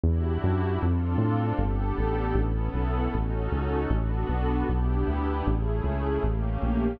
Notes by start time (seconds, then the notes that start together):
0.03 E2 D4 E4 F#4 G4
0.44 F#2
0.82 F2 C4 D4 F4 A4
1.18 A2
1.58 G1 B3 D4 G4 A4
1.98 A1
2.35 A1 B3 C#4 E4 A4
2.74 B1
3.14 A1 C#4 D#4 F#4 A4
3.52 C#2
3.90 A1 B3 D4 F#4 A4
4.29 B1
4.67 B1 B3 D4 E4 G4
5.08 D2
5.46 A1 A3 C#4 E4 G#4
5.84 C#2
6.23 A1 A3 A#3 C#4 G4
6.62 A#1